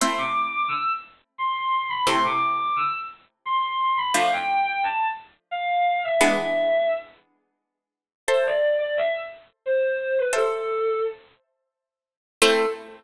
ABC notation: X:1
M:3/4
L:1/16
Q:1/4=87
K:Am
V:1 name="Violin"
c' d'2 d' e' z3 c'3 b | c' d'2 d' e' z3 c'3 b | f g2 g a z3 f3 e | e4 z8 |
c d2 d e z3 c3 B | A4 z8 | A4 z8 |]
V:2 name="Harpsichord"
[A,CE]12 | [C,A,E]12 | [F,A,D]12 | [E,^G,B,D]12 |
[Ace]12 | [Ace]12 | [A,CE]4 z8 |]